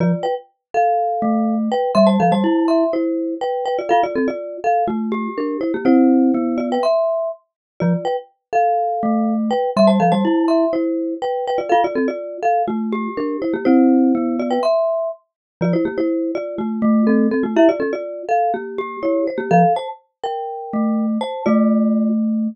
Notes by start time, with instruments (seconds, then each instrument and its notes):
0.00 glockenspiel F3, marimba F4 D5
0.23 marimba B4 G5
0.74 marimba A4 F5
1.22 glockenspiel A3
1.72 marimba B4 G5
1.95 glockenspiel G3, marimba E5 C6
2.07 marimba C5 A5
2.20 glockenspiel F3, marimba A4 F5
2.32 glockenspiel G3, marimba C5 A5
2.44 glockenspiel E4
2.68 marimba E5 C6
2.93 marimba E4 C5
3.41 marimba B4 G5
3.66 marimba B4 G5
3.79 marimba F4 D5
3.89 glockenspiel F4, marimba A4 F5
4.03 marimba F4 D5
4.16 marimba C4 A4
4.28 marimba F4 D5
4.64 marimba A4 F5
4.88 marimba A3 F4
5.12 glockenspiel G4
5.38 marimba D4 A#4
5.61 marimba E4 C5
5.74 marimba A#3 G4
5.85 glockenspiel C4, marimba E4 C5
6.34 glockenspiel B3
6.58 marimba F4 D5
6.72 marimba B4 G5
6.83 marimba E5 C6
7.80 glockenspiel F3, marimba F4 D5
8.05 marimba B4 G5
8.53 marimba A4 F5
9.03 glockenspiel A3
9.51 marimba B4 G5
9.77 glockenspiel G3, marimba E5 C6
9.87 marimba C5 A5
10.00 glockenspiel F3, marimba A4 F5
10.12 glockenspiel G3, marimba C5 A5
10.25 glockenspiel E4
10.48 marimba E5 C6
10.73 marimba E4 C5
11.22 marimba B4 G5
11.47 marimba B4 G5
11.58 marimba F4 D5
11.69 glockenspiel F4, marimba A4 F5
11.84 marimba F4 D5
11.95 marimba C4 A4
12.08 marimba F4 D5
12.43 marimba A4 F5
12.68 marimba A3 F4
12.92 glockenspiel G4
13.17 marimba D4 A#4
13.42 marimba E4 C5
13.54 marimba A#3 G4
13.65 glockenspiel C4, marimba E4 C5
14.15 glockenspiel B3
14.39 marimba F4 D5
14.51 marimba B4 G5
14.63 marimba E5 C6
15.61 glockenspiel F3, marimba F4 D5
15.73 marimba E4 C5
15.85 marimba A#3 G4
15.98 marimba E4 C5
16.35 marimba F4 D5
16.58 marimba A3 F4
16.82 glockenspiel A3
17.07 marimba C4 A4
17.31 marimba C4 A4
17.43 marimba A3 F4
17.57 glockenspiel E4, marimba G4 E5
17.69 marimba F4 D5
17.80 marimba C#4 A4
17.93 marimba F4 D5
18.29 marimba A4 F5
18.54 marimba A#3 G4
18.78 glockenspiel G4
19.03 marimba E4 C#5
19.27 marimba C5
19.38 marimba A#3 G4
19.51 glockenspiel F3, marimba A4 F5
19.76 marimba C5 A5
20.24 marimba A#4 G5
20.73 glockenspiel A3
21.21 marimba C5 A5
21.46 glockenspiel A3, marimba F4 D5